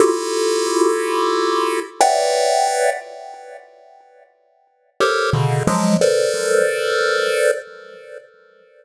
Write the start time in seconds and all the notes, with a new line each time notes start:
0.00 E4 F4 F#4 G4 A4
2.01 B4 C#5 D5 E5 F#5 G5
5.00 G4 A4 A#4 C5 C#5
5.33 B2 C#3 D3
5.67 F3 F#3 G#3
6.01 A4 A#4 B4 C5 D5